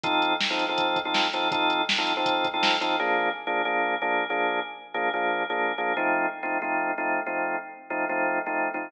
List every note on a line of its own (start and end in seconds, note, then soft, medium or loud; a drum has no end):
0.03 0.33 F3 loud
0.03 0.33 C4 loud
0.03 0.33 D#4 loud
0.03 0.33 A4 loud
0.03 kick loud
0.03 closed hi-hat loud
0.22 closed hi-hat medium
0.41 snare loud
0.50 0.65 F3 medium
0.50 0.65 C4 medium
0.50 0.65 D#4 medium
0.50 0.65 A4 medium
0.59 closed hi-hat medium
0.69 0.98 F3 loud
0.69 0.98 C4 medium
0.69 0.98 D#4 medium
0.69 0.98 A4 medium
0.78 kick medium
0.78 closed hi-hat loud
0.96 kick medium
0.96 closed hi-hat medium
1.05 1.27 F3 medium
1.05 1.27 C4 loud
1.05 1.27 D#4 medium
1.05 1.27 A4 medium
1.14 snare loud
1.33 1.48 F3 loud
1.33 1.48 C4 medium
1.33 1.48 D#4 medium
1.33 1.48 A4 medium
1.33 closed hi-hat medium
1.51 1.82 F3 loud
1.51 1.82 C4 loud
1.51 1.82 D#4 loud
1.51 1.82 A4 loud
1.51 kick loud
1.51 closed hi-hat loud
1.70 closed hi-hat medium
1.89 snare loud
1.98 2.13 F3 medium
1.98 2.13 C4 medium
1.98 2.13 D#4 medium
1.98 2.13 A4 medium
2.07 closed hi-hat medium
2.17 2.46 F3 medium
2.17 2.46 C4 loud
2.17 2.46 D#4 medium
2.17 2.46 A4 medium
2.26 kick loud
2.26 closed hi-hat loud
2.44 kick loud
2.44 closed hi-hat medium
2.54 2.76 F3 medium
2.54 2.76 C4 medium
2.54 2.76 D#4 medium
2.54 2.76 A4 loud
2.63 snare loud
2.81 2.96 F3 loud
2.81 2.96 C4 medium
2.81 2.96 D#4 medium
2.81 2.96 A4 medium
2.81 closed hi-hat medium
2.99 3.29 F3 loud
2.99 3.29 A#3 loud
2.99 3.29 D4 loud
2.99 3.29 G#4 loud
3.47 3.62 F3 medium
3.47 3.62 A#3 medium
3.47 3.62 D4 loud
3.47 3.62 G#4 medium
3.65 3.95 F3 medium
3.65 3.95 A#3 loud
3.65 3.95 D4 loud
3.65 3.95 G#4 medium
4.02 4.24 F3 medium
4.02 4.24 A#3 loud
4.02 4.24 D4 loud
4.02 4.24 G#4 medium
4.30 4.60 F3 medium
4.30 4.60 A#3 medium
4.30 4.60 D4 loud
4.30 4.60 G#4 loud
4.94 5.09 F3 medium
4.94 5.09 A#3 loud
4.94 5.09 D4 medium
4.94 5.09 G#4 medium
5.14 5.43 F3 loud
5.14 5.43 A#3 medium
5.14 5.43 D4 medium
5.14 5.43 G#4 medium
5.50 5.72 F3 medium
5.50 5.72 A#3 loud
5.50 5.72 D4 medium
5.50 5.72 G#4 medium
5.78 5.93 F3 medium
5.78 5.93 A#3 medium
5.78 5.93 D4 medium
5.78 5.93 G#4 medium
5.97 6.26 F3 loud
5.97 6.26 A3 loud
5.97 6.26 C4 loud
5.97 6.26 D#4 loud
6.43 6.58 F3 medium
6.43 6.58 A3 medium
6.43 6.58 C4 loud
6.43 6.58 D#4 medium
6.62 6.91 F3 medium
6.62 6.91 A3 medium
6.62 6.91 C4 loud
6.62 6.91 D#4 medium
6.98 7.20 F3 medium
6.98 7.20 A3 loud
6.98 7.20 C4 medium
6.98 7.20 D#4 medium
7.26 7.56 F3 medium
7.26 7.56 A3 medium
7.26 7.56 C4 loud
7.26 7.56 D#4 medium
7.90 8.05 F3 medium
7.90 8.05 A3 medium
7.90 8.05 C4 medium
7.90 8.05 D#4 medium
8.09 8.39 F3 loud
8.09 8.39 A3 loud
8.09 8.39 C4 loud
8.09 8.39 D#4 medium
8.46 8.69 F3 medium
8.46 8.69 A3 loud
8.46 8.69 C4 medium
8.46 8.69 D#4 medium
8.74 8.89 F3 medium
8.74 8.89 A3 medium
8.74 8.89 C4 medium
8.74 8.89 D#4 medium